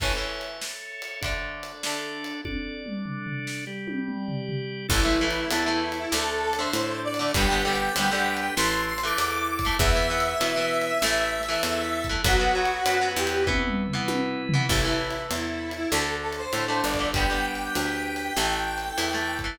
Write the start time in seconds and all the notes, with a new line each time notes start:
0.00 A2 E3 C#4 A4 C#5 E5, kick, crash
0.15 A2 E3 C#4
0.41 ride
0.61 snare
1.02 ride
1.21 D3 A3 D4 A4 D5, kick, ride
1.26 D4
1.63 ride
1.83 D3 A3 D4, snare
2.24 ride
2.45 D4 A4 D5, kick, high tom
2.86 mid tom
3.06 floor tom
3.26 floor tom
3.47 snare
3.67 G3 G4 D5
3.88 high tom
4.08 mid tom
4.28 floor tom
4.49 floor tom
4.89 A1 E3 A3 E4 A4, kick, crash
5.05 E3 A3
5.21 E3 A3
5.31 ride
5.51 E2 E3 A3 E4, ride
5.66 E3 A3
5.92 ride
5.99 E4
6.12 D2 D3 A3 D4 A4, snare
6.42 A4
6.53 ride
6.58 D3 A3 C5
6.73 A2, ride
7.04 D5
7.14 ride
7.19 D3 A3
7.34 G1 D3 G3 B3 D4 G4 B4 G5, kick, ride
7.50 D3 G3 B3
7.65 D3 G3 B3
7.76 ride
7.96 D2 D3 G3 B3 G5, ride
8.11 D3 G3 B3
8.37 G5, ride
8.56 A1 E3 A3 E4 A4 C6, snare
8.87 C6
8.98 ride
9.03 E3 A3 D6
9.18 E2, ride
9.48 D6
9.59 kick, ride
9.65 E3 A3
9.78 E2 E3 B3 E4 B4 E5, kick, ride
9.95 E3 B3
10.10 E3 B3
10.20 ride
10.40 B2 E3 B3, ride
10.56 E3 B3
10.82 ride
11.02 A1 E3 A3 E4 A4, snare
11.43 ride
11.48 E3 A3
11.63 E2, ride
12.04 kick, ride
12.09 E3 A3
12.24 B1 F#3 B3 F#4 B4, kick, ride
12.40 F#3 B3
12.55 F#3 B3
12.65 ride
12.86 F#2 F#3 B3, ride
13.01 F#3 B3
13.16 E2 G4
13.27 ride
13.47 E3 B3 E4 B4, kick, high tom
13.67 mid tom
13.88 floor tom
13.93 E3 B3
14.08 B2, high tom
14.49 floor tom
14.54 E3 B3
14.69 A1 E3 A3 E4 A4, kick, crash
14.85 E3 A3
15.10 ride
15.31 E2 E4, ride
15.71 ride
15.77 E4
15.90 D2 D3 A3 D4 A4, snare
16.22 A4
16.33 ride
16.38 C5
16.53 A2 D3 A3, ride
16.68 D3 A3
16.83 G1 D5
16.94 kick, ride
16.99 D3 A3
17.13 D3 G3 D4 G4 B4 G5, kick, ride
17.17 B3
17.30 D3 G3 B3
17.55 ride
17.75 D2, ride
18.16 ride
18.36 A1 E3 A3 E4 A4, snare
18.78 ride
18.97 E2 E3 A3, ride
19.13 E3 A3
19.39 kick, ride
19.44 E3 A3